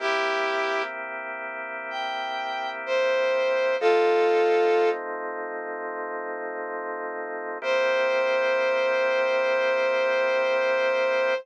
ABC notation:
X:1
M:12/8
L:1/8
Q:3/8=63
K:C
V:1 name="Brass Section"
[EG]3 z3 g3 c3 | [FA]4 z8 | c12 |]
V:2 name="Drawbar Organ"
[C,_B,EG]12 | [F,A,C_E]12 | [C,_B,EG]12 |]